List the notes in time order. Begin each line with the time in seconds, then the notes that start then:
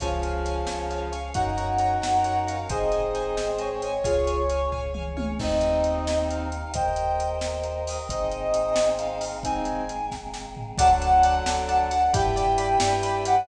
0.00 C#2 C#3 F3 C#4 F4 G#4 C#5 F5 G#5, kick, closed hi-hat
0.22 C#5 F5 G#5, closed hi-hat
0.45 C#5 F5 G#5, closed hi-hat
0.67 C#2 C#4 G#4 C#5 F5 G#5, snare
0.90 C#5 F5 G#5, closed hi-hat
1.12 C#5 F5 G#5, closed hi-hat
1.34 F#2 C#4 D#4 F#4 A#4 C#5 F#5 A#5, kick, closed hi-hat
1.57 C#5 F#5 A#5, closed hi-hat
1.78 C#5 F#5 A#5, closed hi-hat
2.02 F#2 C#4 A#4 C#5 F#5 A#5, snare
2.24 C#5 F#5 A#5, closed hi-hat
2.47 C#5 F5 F#5 A#5, closed hi-hat
2.69 G#1 C4 D#4 G#4 C5 D#5 G#5, kick, closed hi-hat
2.92 C5 D#5 G#5, closed hi-hat
3.15 C5 D#5 G#5, closed hi-hat
3.37 G#1 G#3 C4 G#4 C5 D#5 G#5, snare
3.59 C5 C#5 D#5 G#5, closed hi-hat
3.82 C5 D#5 G#5, closed hi-hat
4.04 C#2 C#4 F4 G#4 C#5 F5 G#5, kick, closed hi-hat
4.27 C#5 F5 G#5, closed hi-hat
4.49 C#5 F5 G#5, closed hi-hat
4.72 C#2 C#4 G#4 C#5 F5 G#5, kick, floor tom
4.94 C#5 F5 G#5, mid tom
5.17 C#5 F5 G#5, high tom
5.39 D#2 A#3 C4 D#4 G4 D#5, kick, crash
5.61 closed hi-hat
5.84 closed hi-hat
6.07 snare
6.29 F5, closed hi-hat
6.52 closed hi-hat
6.74 D#2 A#3 G4 A#4 C5 D#5 G5, kick, closed hi-hat
6.96 closed hi-hat
7.20 closed hi-hat
7.41 snare
7.63 closed hi-hat
7.87 D#5, open hi-hat
8.09 G#1 A#3 C4 D#4 G#4 C5 D#5, kick, closed hi-hat
8.31 closed hi-hat
8.54 closed hi-hat
8.76 snare
8.99 F5, closed hi-hat
9.21 open hi-hat
9.43 G#1 G#3 A#3 C4 D#4 G#4 G#5, kick, closed hi-hat
9.65 closed hi-hat
9.89 closed hi-hat
10.11 kick, snare
10.34 snare
10.57 floor tom
10.78 D2 D3 F#3 D4 F#4 A4 D5 F#5 A5, kick, closed hi-hat
11.02 D5 F#5 A5, closed hi-hat
11.23 D5 F#5 A5, closed hi-hat
11.46 D2 D4 A4 D5 F#5 A5, snare
11.68 D5 F#5 A5, closed hi-hat
11.91 D5 F#5 A5, closed hi-hat
12.13 G2 D4 E4 G4 B4 D5 G5 B5, kick, closed hi-hat
12.36 D5 G5 B5, closed hi-hat
12.58 D5 G5 B5, closed hi-hat
12.80 G2 D4 B4 D5 G5 B5, snare
13.03 D5 G5 B5, closed hi-hat
13.25 D5 F#5 G5 B5, closed hi-hat